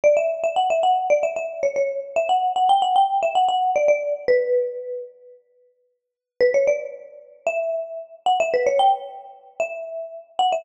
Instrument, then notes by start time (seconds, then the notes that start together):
marimba
0.04 D5
0.17 E5
0.43 E5
0.56 F#5
0.70 E5
0.83 F#5
1.10 D5
1.23 E5
1.36 E5
1.63 C#5
1.76 C#5
2.16 E5
2.29 F#5
2.56 F#5
2.69 G5
2.82 F#5
2.96 G5
3.22 E5
3.35 F#5
3.48 F#5
3.76 D5
3.88 D5
4.28 B4
6.40 B4
6.54 C#5
6.67 D5
7.46 E5
8.26 F#5
8.40 E5
8.54 B4
8.66 C#5
8.79 G5
9.60 E5
10.39 F#5
10.52 E5